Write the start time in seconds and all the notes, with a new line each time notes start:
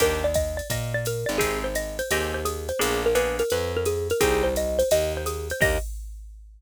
0.00 D#2 A#3 D4 D#4 G4 A#4, kick, ride
0.24 D5
0.34 D#5, kick, hi-hat pedal, ride
0.57 D5, ride
0.70 A#2 D#5, kick, ride
0.94 D5
1.05 A#4, hi-hat pedal, ride
1.26 G#1 D5, ride
1.38 C4 D#4 G4 G#4, kick, ride
1.64 C5
1.75 D#5, hi-hat pedal, ride
1.99 C5, ride
2.11 D#2 C4 D#4 G4 G#4 D#5, ride
2.34 C5
2.45 G#4, hi-hat pedal, ride
2.69 C5, ride
2.79 A#1 A#3 B3 D4 G#4, ride
3.06 A#4
3.15 A#3 B3 D4 G#4 B4, hi-hat pedal, ride
3.39 A#4, ride
3.50 F2 B4, ride
3.77 A#4
3.85 G#4, hi-hat pedal, ride
4.10 A#4, ride
4.20 C2 C4 D#4 G4 G#4, kick, ride
4.44 C5
4.56 D#5, hi-hat pedal, ride
4.79 C5, ride
4.91 D#2 D#5, ride
5.17 C5
5.26 G#4, hi-hat pedal, ride
5.50 C5, ride
5.60 D#2 A#3 D4 D#4 G4 D#5, kick, crash